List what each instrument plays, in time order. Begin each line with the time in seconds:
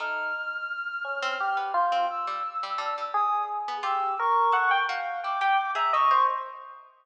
0.00 harpsichord A3, electric piano 1 D#4, clarinet F6
1.04 electric piano 1 C#4
1.23 harpsichord C4
1.40 electric piano 1 G4
1.57 harpsichord B3
1.74 electric piano 1 F4, clarinet G6
1.92 harpsichord C4
2.10 clarinet E6
2.27 harpsichord G3
2.63 harpsichord G3
2.78 harpsichord G3, electric piano 1 D4
2.98 harpsichord G3
3.14 electric piano 1 G#4, clarinet D#6
3.68 harpsichord B3
3.83 harpsichord F4, electric piano 1 G4, clarinet E6
4.19 electric piano 1 A#4, clarinet C#6
4.52 harpsichord A4, electric piano 1 F#5
4.71 electric piano 1 G5
4.89 harpsichord F#4, electric piano 1 F5
5.23 harpsichord E4, electric piano 1 G5, clarinet D6
5.41 harpsichord G4, electric piano 1 G5
5.75 harpsichord G#4, electric piano 1 E5, clarinet A#5
5.93 harpsichord A4, electric piano 1 D#5, clarinet C#6
6.11 harpsichord A#4, electric piano 1 C5